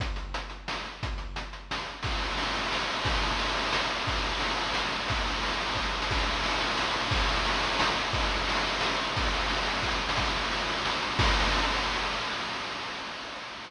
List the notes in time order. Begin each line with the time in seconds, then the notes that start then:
0.00 kick, closed hi-hat
0.16 closed hi-hat
0.34 closed hi-hat
0.50 closed hi-hat
0.68 snare
0.85 closed hi-hat
1.03 kick, closed hi-hat
1.18 closed hi-hat
1.36 closed hi-hat
1.53 closed hi-hat
1.71 snare
1.86 closed hi-hat
2.03 kick, crash
2.11 ride
2.21 ride
2.30 ride
2.37 ride
2.46 ride
2.53 ride
2.63 ride
2.72 snare
2.80 ride
2.90 ride
2.96 ride
3.05 kick, ride
3.13 ride
3.22 ride
3.31 ride
3.39 ride
3.48 ride
3.57 ride
3.65 ride
3.72 snare
3.90 ride
3.98 ride
4.07 kick, ride
4.15 ride
4.22 ride
4.31 ride
4.40 ride
4.51 ride
4.56 ride
4.65 ride
4.74 snare
4.84 ride
4.92 ride
4.99 ride
5.08 kick, ride
5.17 ride
5.26 ride
5.34 ride
5.42 ride
5.51 ride
5.61 ride
5.68 ride
5.75 kick, snare
5.84 snare
6.02 snare
6.11 kick, crash
6.18 ride
6.27 ride
6.35 ride
6.43 ride
6.52 ride
6.61 ride
6.68 ride
6.77 snare
6.87 ride
6.94 ride
7.05 ride
7.11 kick, ride
7.21 ride
7.29 ride
7.38 ride
7.45 ride
7.54 ride
7.63 ride
7.72 ride
7.79 snare
7.95 ride
8.05 ride
8.13 kick, ride
8.22 ride
8.31 ride
8.39 ride
8.49 ride
8.55 ride
8.65 ride
8.72 ride
8.81 snare
8.89 ride
8.97 ride
9.08 ride
9.16 kick, ride
9.22 ride
9.32 ride
9.41 ride
9.49 ride
9.57 ride
9.65 ride
9.76 ride
9.83 kick, snare
9.91 snare
10.09 snare
10.16 kick, crash
10.25 ride
10.34 ride
10.44 ride
10.51 ride
10.59 ride
10.67 ride
10.77 ride
10.85 snare
10.94 ride
11.02 ride
11.11 ride
11.19 kick, crash